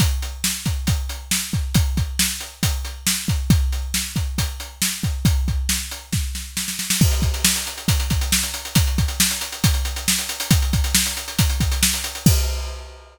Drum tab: CC |----------------|----------------|----------------|----------------|
HH |x-x---x-x-x---x-|x-x---x-x-x---x-|x-x---x-x-x---x-|x-x---x---------|
SD |----o-------o---|----o-------o---|----o-------o---|----o---o-o-oooo|
BD |o-----o-o-----o-|o-o-----o-----o-|o-----o-o-----o-|o-o-----o-------|

CC |x---------------|----------------|----------------|x---------------|
HH |-xxx-xxxxxxx-xxx|xxxx-xxxxxxx-xxx|xxxx-xxxxxxx-xxx|----------------|
SD |----o-------o---|----o-------o---|----o-------o---|----------------|
BD |o-o-----o-o-----|o-o-----o-------|o-o-----o-o-----|o---------------|